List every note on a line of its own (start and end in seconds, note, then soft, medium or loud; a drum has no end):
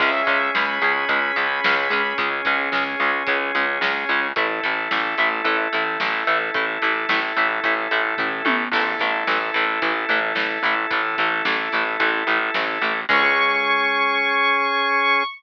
0.00 0.22 C#2 medium
0.00 0.11 G#3 loud
0.00 4.28 C#4 medium
0.00 0.11 C#4 loud
0.00 4.28 G#4 medium
0.00 0.49 E5 medium
0.00 kick loud
0.00 crash medium
0.27 0.50 C#2 medium
0.27 0.38 G#3 medium
0.27 0.38 C#4 medium
0.27 kick medium
0.27 closed hi-hat medium
0.55 0.79 C#2 medium
0.55 0.66 G#3 medium
0.55 0.66 C#4 medium
0.55 2.13 B5 medium
0.55 snare loud
0.82 1.05 C#2 medium
0.82 0.93 G#3 medium
0.82 0.93 C#4 medium
0.82 closed hi-hat medium
1.09 1.32 C#2 medium
1.09 1.20 G#3 medium
1.09 1.20 C#4 medium
1.09 kick medium
1.09 closed hi-hat loud
1.36 1.60 C#2 medium
1.36 1.47 G#3 medium
1.36 1.47 C#4 medium
1.36 closed hi-hat medium
1.64 1.88 C#2 medium
1.64 1.75 G#3 medium
1.64 1.75 C#4 medium
1.64 snare loud
1.90 2.13 C#2 medium
1.90 2.02 G#3 medium
1.90 2.02 C#4 medium
1.90 closed hi-hat medium
2.18 2.41 C#2 medium
2.18 2.30 G#3 loud
2.18 2.30 C#4 medium
2.18 kick loud
2.18 closed hi-hat medium
2.45 2.70 C#2 medium
2.45 2.56 G#3 medium
2.45 2.56 C#4 medium
2.45 kick medium
2.45 closed hi-hat medium
2.72 2.95 C#2 medium
2.72 2.84 G#3 medium
2.72 2.84 C#4 medium
2.72 snare loud
3.00 3.23 C#2 medium
3.00 3.11 G#3 medium
3.00 3.11 C#4 medium
3.00 closed hi-hat medium
3.27 3.51 C#2 medium
3.27 3.38 G#3 medium
3.27 3.38 C#4 medium
3.27 kick loud
3.27 closed hi-hat medium
3.55 3.78 C#2 medium
3.55 3.66 G#3 medium
3.55 3.66 C#4 medium
3.55 closed hi-hat medium
3.81 4.04 C#2 medium
3.81 3.93 G#3 medium
3.81 3.93 C#4 medium
3.81 snare loud
4.09 4.32 C#2 medium
4.09 4.20 G#3 medium
4.09 4.20 C#4 medium
4.09 closed hi-hat medium
4.36 4.60 A1 medium
4.36 4.47 A3 medium
4.36 8.64 E4 medium
4.36 4.47 E4 loud
4.36 8.64 A4 medium
4.36 kick loud
4.36 closed hi-hat loud
4.63 4.88 A1 medium
4.63 4.74 A3 medium
4.63 4.74 E4 medium
4.63 kick medium
4.63 closed hi-hat medium
4.91 5.15 A1 medium
4.91 5.02 A3 medium
4.91 5.02 E4 medium
4.91 snare loud
5.18 5.41 A1 medium
5.18 5.29 A3 medium
5.18 5.29 E4 medium
5.18 closed hi-hat medium
5.44 5.68 A1 medium
5.44 5.57 A3 medium
5.44 5.57 E4 medium
5.44 kick medium
5.44 closed hi-hat loud
5.73 5.97 A1 medium
5.73 5.84 A3 medium
5.73 5.84 E4 medium
5.73 closed hi-hat medium
6.00 6.24 A1 medium
6.00 6.11 A3 medium
6.00 6.11 E4 medium
6.00 snare loud
6.27 6.50 A1 medium
6.27 6.38 A3 medium
6.27 6.38 E4 medium
6.27 closed hi-hat medium
6.54 6.78 A1 medium
6.54 6.66 A3 medium
6.54 6.66 E4 medium
6.54 kick loud
6.54 closed hi-hat medium
6.82 7.06 A1 medium
6.82 6.93 A3 medium
6.82 6.93 E4 medium
6.82 kick medium
6.82 closed hi-hat medium
7.09 7.33 A1 medium
7.09 7.20 A3 medium
7.09 7.20 E4 medium
7.09 snare loud
7.36 7.60 A1 medium
7.36 7.48 A3 medium
7.36 7.48 E4 medium
7.36 closed hi-hat medium
7.64 7.88 A1 medium
7.64 7.74 A3 medium
7.64 7.74 E4 medium
7.64 kick medium
7.64 closed hi-hat medium
7.91 8.15 A1 medium
7.91 8.02 A3 medium
7.91 8.02 E4 medium
7.91 closed hi-hat medium
8.18 8.42 A1 medium
8.18 8.29 A3 medium
8.18 8.29 E4 medium
8.18 kick medium
8.18 floor tom medium
8.45 8.68 A1 medium
8.45 8.57 A3 medium
8.45 8.57 E4 medium
8.45 high tom loud
8.72 8.95 A1 loud
8.72 8.84 E3 loud
8.72 8.84 A3 medium
8.72 13.01 E4 medium
8.72 13.01 A4 medium
8.72 kick medium
8.72 crash loud
8.99 9.24 A1 medium
8.99 9.11 E3 medium
8.99 9.11 A3 medium
8.99 kick medium
8.99 closed hi-hat medium
9.27 9.51 A1 medium
9.27 9.38 E3 medium
9.27 9.38 A3 medium
9.27 snare loud
9.54 9.79 A1 medium
9.54 9.65 E3 medium
9.54 9.65 A3 medium
9.54 closed hi-hat medium
9.82 10.05 A1 medium
9.82 9.93 E3 medium
9.82 9.93 A3 medium
9.82 kick medium
9.82 closed hi-hat medium
10.09 10.33 A1 medium
10.09 10.20 E3 medium
10.09 10.20 A3 medium
10.09 closed hi-hat medium
10.35 10.58 A1 medium
10.35 10.47 E3 medium
10.35 10.47 A3 medium
10.35 snare loud
10.63 10.86 A1 medium
10.63 10.75 E3 medium
10.63 10.75 A3 medium
10.63 closed hi-hat medium
10.90 11.15 A1 medium
10.90 11.01 E3 medium
10.90 11.01 A3 medium
10.90 kick loud
10.90 closed hi-hat loud
11.18 11.42 A1 medium
11.18 11.29 E3 medium
11.18 11.29 A3 medium
11.18 kick medium
11.18 closed hi-hat medium
11.45 11.68 A1 medium
11.45 11.56 E3 medium
11.45 11.56 A3 medium
11.45 snare loud
11.72 11.97 A1 medium
11.72 11.84 E3 medium
11.72 11.84 A3 medium
11.72 closed hi-hat medium
12.00 12.23 A1 medium
12.00 12.11 E3 medium
12.00 12.11 A3 medium
12.00 kick medium
12.00 closed hi-hat loud
12.27 12.50 A1 medium
12.27 12.39 E3 medium
12.27 12.39 A3 medium
12.27 closed hi-hat medium
12.54 12.78 A1 medium
12.54 12.65 E3 medium
12.54 12.65 A3 medium
12.54 snare loud
12.81 13.05 A1 medium
12.81 12.93 E3 medium
12.81 12.93 A3 medium
12.81 closed hi-hat medium
13.09 15.24 C#2 loud
13.09 15.23 G#3 loud
13.09 15.23 C#4 loud
13.09 15.23 G#4 loud
13.09 15.24 C#6 loud
13.09 kick loud
13.09 crash loud